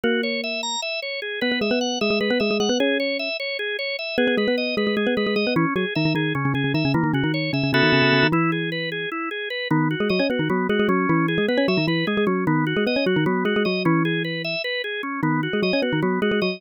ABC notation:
X:1
M:7/8
L:1/16
Q:1/4=152
K:B
V:1 name="Xylophone"
[A,A]8 z6 | [B,B] [B,B] [G,G] [B,B]3 [G,G] [G,G] [G,G] [B,B] [G,G] [G,G] [G,G] [B,B] | [Cc]6 z8 | [B,B] [B,B] [G,G] [B,B]3 [G,G] [G,G] [G,G] [B,B] [G,G] [G,G] [G,G] [B,B] |
[E,E] z [F,F] z [D,D] [D,D] [D,D]2 [C,C] [C,C] [C,C] [C,C] [D,D] [C,C] | [E,E] [D,D] [C,C] [D,D]3 [C,C] [C,C] [C,C] [D,D] [C,C] [C,C] [C,C] [D,D] | [E,E]8 z6 | [D,D]3 [G,G] [F,F] [Cc] [B,B] [D,D] [F,F]2 [G,G] [G,G] [F,F]2 |
[E,E]3 [G,G] [B,B] [Cc] [F,F] [D,D] [E,E]2 [G,G] [G,G] [F,F]2 | [D,D]3 [G,G] [B,B] [Cc] [F,F] [D,D] [F,F]2 [G,G] [G,G] [F,F]2 | [E,E]8 z6 | [D,D]3 [G,G] [F,F] [Cc] [B,B] [D,D] [F,F]2 [G,G] [G,G] [F,F]2 |]
V:2 name="Drawbar Organ"
F2 c2 e2 a2 e2 c2 G2 | B2 e2 f2 e2 B2 e2 f2 | G2 c2 e2 c2 G2 c2 e2 | G2 B2 d2 B2 G2 B2 d2 |
C2 G2 e2 G2 C2 G2 e2 | A,2 F2 c2 e2 [B,F=Ae]6 | E2 G2 B2 G2 E2 G2 B2 | B,2 F2 d2 F2 B,2 F2 C2- |
C2 G2 B2 e2 B2 G2 C2 | B,2 F2 d2 F2 B,2 F2 d2 | C2 G2 B2 e2 B2 G2 C2 | B,2 F2 d2 F2 B,2 F2 d2 |]